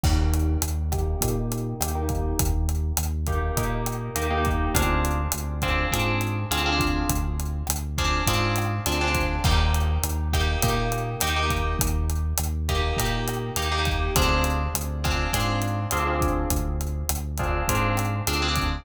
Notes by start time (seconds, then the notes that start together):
0.03 D#2 A#3 D#4 G4, kick, cross-stick, crash
0.33 closed hi-hat
0.62 D#2, closed hi-hat
0.92 A#3 D#4 G4, kick, cross-stick, closed hi-hat
1.21 A#2 A#3 D#4 G4, kick, closed hi-hat
1.52 closed hi-hat
1.80 D#2 A#3 D#4 G4, cross-stick, closed hi-hat
1.95 A#3 D#4 G4
2.09 kick, closed hi-hat
2.39 D#2, kick, closed hi-hat
2.69 closed hi-hat
2.97 D#2, cross-stick, closed hi-hat
3.26 A#3 D#4 G4, kick, closed hi-hat
3.57 A#2 A#3 D#4 G4, kick, closed hi-hat
3.86 cross-stick, closed hi-hat
4.15 D#2 A#3 D#4 G4, closed hi-hat
4.31 A#3 D#4 G4
4.45 kick, closed hi-hat
4.74 D2 C4 D4 F4 G#4, kick, cross-stick, closed hi-hat
5.05 closed hi-hat
5.32 D2, closed hi-hat
5.62 C4 D4 F4 G#4, kick, cross-stick, closed hi-hat
5.91 G#2 C4 D4 F4 G#4, kick, closed hi-hat
6.21 closed hi-hat
6.51 D2 C4 D4 F4 G#4, cross-stick, closed hi-hat
6.66 C4 D4 F4 G#4
6.80 kick, closed hi-hat
7.09 D2, kick, closed hi-hat
7.40 closed hi-hat
7.67 D2, cross-stick, closed hi-hat
7.98 C4 D4 F4 G#4, kick, closed hi-hat
8.27 G#2 C4 D4 F4 G#4, kick, closed hi-hat
8.56 cross-stick, closed hi-hat
8.86 D2 C4 D4 F4 G#4, closed hi-hat
9.01 C4 D4 F4 G#4
9.15 kick, closed hi-hat
9.44 D#2 A#3 D#4 G4, kick, cross-stick, crash
9.74 closed hi-hat
10.03 D#2, closed hi-hat
10.33 A#3 D#4 G4, kick, cross-stick, closed hi-hat
10.62 A#2 A#3 D#4 G4, kick, closed hi-hat
10.92 closed hi-hat
11.20 D#2 A#3 D#4 G4, cross-stick, closed hi-hat
11.36 A#3 D#4 G4
11.50 kick, closed hi-hat
11.79 D#2, kick, closed hi-hat
12.10 closed hi-hat
12.37 D#2, cross-stick, closed hi-hat
12.69 A#3 D#4 G4, kick, closed hi-hat
12.97 A#2 A#3 D#4 G4, kick, closed hi-hat
13.28 cross-stick, closed hi-hat
13.56 D#2 A#3 D#4 G4, closed hi-hat
13.72 A#3 D#4 G4
13.85 kick, closed hi-hat
14.16 D2 C4 D4 F4 G#4, kick, cross-stick, closed hi-hat
14.44 closed hi-hat
14.74 D2, closed hi-hat
15.04 C4 D4 F4 G#4, kick, cross-stick, closed hi-hat
15.33 G#2 C4 D4 F4 G#4, kick, closed hi-hat
15.62 closed hi-hat
15.91 D2 C4 D4 F4 G#4, cross-stick, closed hi-hat
16.07 C4 D4 F4 G#4
16.21 kick, closed hi-hat
16.50 D2, kick, closed hi-hat
16.81 closed hi-hat
17.09 D2, cross-stick, closed hi-hat
17.37 C4 D4 F4 G#4, kick, closed hi-hat
17.68 G#2 C4 D4 F4 G#4, kick, closed hi-hat
17.97 cross-stick, closed hi-hat
18.27 D2 C4 D4 F4 G#4, closed hi-hat
18.42 C4 D4 F4 G#4
18.56 kick, closed hi-hat